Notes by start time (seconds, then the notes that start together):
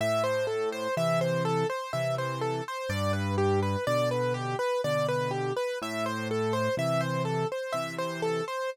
0.01 A2 E5
0.24 C5
0.47 A4
0.72 C5
0.97 C3 E3 E5
1.21 C5
1.45 A4
1.70 C5
1.93 C3 E3 E5
2.18 C5
2.41 A4
2.68 C5
2.89 G2 D5
3.13 B4
3.38 G4
3.63 B4
3.87 B2 D3 D5
4.11 B4
4.34 G4
4.59 B4
4.84 B2 D3 D5
5.08 B4
5.31 G4
5.56 B4
5.82 A2 E5
6.06 C5
6.31 A4
6.53 C5
6.77 C3 E3 E5
7.01 C5
7.25 A4
7.52 C5
7.73 C3 E3 E5
7.98 C5
8.22 A4
8.48 C5